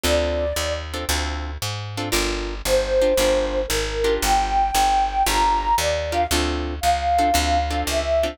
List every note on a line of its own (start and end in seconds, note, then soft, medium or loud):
0.04 0.53 D2 medium
0.04 0.46 C4 medium
0.04 0.46 D4 loud
0.04 0.46 F4 medium
0.04 0.46 A4 medium
0.04 0.73 D5 medium
0.56 1.05 D#2 medium
0.94 1.05 C4 medium
0.94 1.05 D4 medium
0.94 1.05 F4 medium
0.94 1.05 A4 medium
1.09 1.58 D2 medium
1.09 1.51 C4 loud
1.09 1.51 D4 medium
1.09 1.51 F4 medium
1.09 1.51 A4 medium
1.62 2.11 G#2 medium
1.97 2.09 C4 medium
1.97 2.09 D4 medium
1.97 2.09 F4 medium
1.97 2.09 A4 medium
2.12 2.62 G1 medium
2.12 2.54 D4 loud
2.12 2.54 F4 loud
2.12 2.54 G4 medium
2.12 2.54 A#4 loud
2.65 3.14 G1 medium
2.65 3.59 C5 medium
3.02 3.13 D4 medium
3.02 3.13 F4 medium
3.02 3.13 G4 medium
3.02 3.13 A#4 medium
3.17 3.66 G1 medium
3.17 3.62 D4 medium
3.17 3.62 F4 medium
3.17 3.62 G4 loud
3.17 3.62 A#4 loud
3.67 4.19 G#1 medium
3.67 4.14 A#4 medium
4.04 4.63 D4 medium
4.04 4.63 F4 medium
4.04 4.63 G4 medium
4.04 4.63 A#4 medium
4.22 4.71 G1 medium
4.22 5.22 G5 medium
4.75 5.23 G1 medium
5.27 5.75 G1 medium
5.27 5.69 D4 medium
5.27 5.69 F4 loud
5.27 5.69 G4 medium
5.27 5.69 A#4 medium
5.27 5.75 A#5 medium
5.78 6.27 D#2 medium
5.78 6.12 D5 medium
6.12 6.24 D4 medium
6.12 6.24 F4 medium
6.12 6.24 G4 medium
6.12 6.24 A#4 medium
6.12 6.27 F5 medium
6.31 6.80 D2 medium
6.31 6.75 C4 medium
6.31 6.75 D4 loud
6.31 6.75 F4 loud
6.31 6.75 A4 loud
6.81 7.32 C#2 medium
6.81 7.81 F5 medium
7.19 7.30 C4 medium
7.19 7.30 D4 medium
7.19 7.30 F4 medium
7.19 7.30 A4 medium
7.34 7.84 D2 loud
7.34 7.59 C4 medium
7.34 7.59 D4 medium
7.34 7.59 F4 medium
7.34 7.59 A4 medium
7.71 8.01 C4 medium
7.71 8.01 D4 medium
7.71 8.01 F4 medium
7.71 8.01 A4 medium
7.87 8.36 C#2 medium
7.87 8.37 E5 medium
8.23 8.35 C4 medium
8.23 8.35 D4 medium
8.23 8.35 F4 medium
8.23 8.35 A4 medium